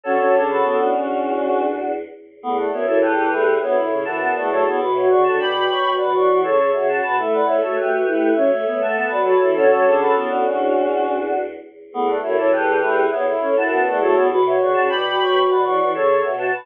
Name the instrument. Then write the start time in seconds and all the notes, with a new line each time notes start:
choir aahs
0.03 D3 C#4 F#4 A4 C#5
0.19 F#3 C#4
0.34 C#3 D4
0.49 F#4 A4 B4
0.63 A2 B3
0.79 A2 D4 F#4
0.92 E2 C#4
2.41 E2 A3 B3
2.57 A3 D5 F#5
2.71 F#2 B3 C#5 E5
2.86 F#2 E3 A4 C#5
3.01 E2 G4 A4 B4
3.16 E3
3.30 E2 A3 E4
3.61 D2 B3 C#5 E5
3.75 A2 E4 C#5 E5
3.90 A2 C#3
4.05 F#2 E3 E4 F#5 A5
4.21 B3 F#5 A5
4.35 E2 A3 D5 F#5
4.49 F#3 A3 A4 C#5
4.66 E2 B3
4.78 B2 F#4 B4
4.94 F#4 C#5 E5
5.09 C#3 C#5 D5 F#5
5.24 D3 F#5 A5
5.39 B2 D5 G5 B5
5.68 B2 C#5
5.97 B2 B4 D5 F#5
6.13 E3 C#5 D5 F#5
6.28 E3
6.43 C#3 A4 C#5
6.58 A4 C#5
6.73 C#3 F#4 C#5 E5
6.88 F#4 F#5 A5
7.02 B2 B4
7.16 A3 E4 E5
7.31 B4 D5 F#5
7.46 A3 E4 C#5 E5
7.61 A3 F#4 A4 C#5
7.76 A3 G4 B4 E5
7.92 F#4
8.06 A3 E4 E5
8.35 F#3 C#4 C#5 E5
8.51 A3 C#5 E5
8.66 A3 B3
8.79 A3 E5 F#5 A5
8.96 B3 F#5 A5
9.09 F#3 B4 D5 F#5
9.24 F#4 A4 B4 C#5
9.40 E3 E4
9.54 D3 C#4 F#4 A4 C#5
9.70 F#3 C#4
9.84 C#3 D4
10.00 F#4 A4 B4
10.15 A2 B3
10.30 A2 D4 F#4
10.45 E2 C#4
11.91 E2 A3 B3
12.07 A3 D5 F#5
12.22 F#2 A3 E4 C#5 E5
12.37 F#2 E3 A4 C#5
12.52 E2 G4 A4 B4
12.67 E3
12.81 E2 A3 E4
13.11 E2 B3 C#5 E5
13.25 A2 E4 C#5 E5
13.41 A2 C#4
13.56 F#2 E4 F#5 A5
13.71 B3 F#5 A5
13.86 E2 A3 D5 F#5
14.00 F#3 A3 A4 C#5
14.14 E2 B3
14.30 B2 F#4 B4
14.45 F#4 C#5 E5
14.59 C#3 C#5 D5 F#5
14.74 C#3 F#5 A5
14.89 B2 D5 G5 B5
15.19 B2 C#5
15.47 B2 B4 D5 F#5
15.63 E3 C#5 D5 F#5
15.80 E3
15.92 C#3 A4 C#5
16.09 A4 C#5
16.22 B2 F#4 C#5 E5
16.37 F#4 F#5 A5
16.53 B2 B4